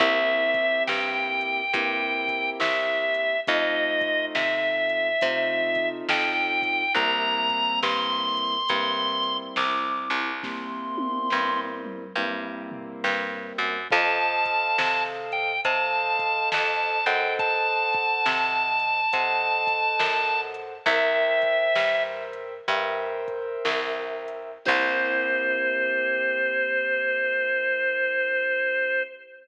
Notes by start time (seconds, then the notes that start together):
0.00 C2 A#3 C4 E4 G4 E5, kick, closed hi-hat
0.54 kick, closed hi-hat
0.87 G2 G5, snare
1.41 closed hi-hat
1.73 G2 A#3 C4 E4 G4, kick, closed hi-hat
2.28 kick, closed hi-hat
2.60 C2 E5, snare
3.14 closed hi-hat
3.47 F2 A3 C4 D#4 F4 D#5, kick, closed hi-hat
4.01 kick, closed hi-hat
4.35 C3 E5, snare
4.89 closed hi-hat
5.21 C3 A3 C4 D#4 F4, kick, closed hi-hat
5.75 kick, closed hi-hat
6.09 F2 G5, snare
6.62 kick, closed hi-hat
6.95 C2 G3 A#3 C4 E4 A#5, kick, closed hi-hat
7.50 kick, closed hi-hat
7.83 G2 C6, snare
8.37 closed hi-hat
8.69 G2 G3 A#3 C4 E4, kick, closed hi-hat
9.23 closed hi-hat
9.56 C2 D6, snare
10.10 C2, closed hi-hat
10.43 G3 A#3 C4 E4 C6, kick, snare
10.98 high tom
11.30 G2, snare
11.84 mid tom
12.16 G2 G3 A#3 C4 E4
12.71 floor tom
13.04 G2, snare
13.58 F#2
13.91 F2 A4 C5 D#5 F5 A5, kick, crash
14.45 kick, closed hi-hat
14.78 C3, snare
15.32 G5, closed hi-hat
15.65 C3 A4 C5 D#5 F5 A5, kick, closed hi-hat
16.19 kick, closed hi-hat
16.52 F2 A5, snare
17.06 F#2 A4 C5 D#5 F#5 G5, closed hi-hat
17.39 A5, kick, closed hi-hat
17.93 kick, closed hi-hat
18.26 C3, snare
18.80 closed hi-hat
19.13 C3 A4 C5 D#5 F#5, kick, closed hi-hat
19.67 kick, closed hi-hat
19.99 F#2, snare
20.54 closed hi-hat
20.86 C2 A#4 C5 E5 G5, kick, closed hi-hat
21.42 kick, closed hi-hat
21.76 G2, snare
22.33 closed hi-hat
22.68 G2 A#4 C5 E5 G5, kick, closed hi-hat
23.28 kick, closed hi-hat
23.65 C2, snare
24.28 closed hi-hat
24.65 C2 A#3 C4 E4 G4 C5, kick, crash